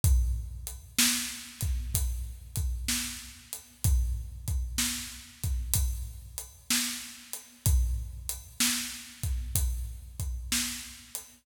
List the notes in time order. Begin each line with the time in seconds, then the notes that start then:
0.04 kick, closed hi-hat
0.67 closed hi-hat
0.99 snare
1.61 kick, closed hi-hat
1.95 kick, closed hi-hat
2.56 kick, closed hi-hat
2.88 snare
3.53 closed hi-hat
3.85 kick, closed hi-hat
4.48 kick, closed hi-hat
4.78 snare
5.44 kick, closed hi-hat
5.74 kick, closed hi-hat
6.38 closed hi-hat
6.70 snare
7.34 closed hi-hat
7.66 kick, closed hi-hat
8.29 closed hi-hat
8.60 snare
9.23 kick, closed hi-hat
9.55 kick, closed hi-hat
10.20 kick, closed hi-hat
10.52 snare
11.15 closed hi-hat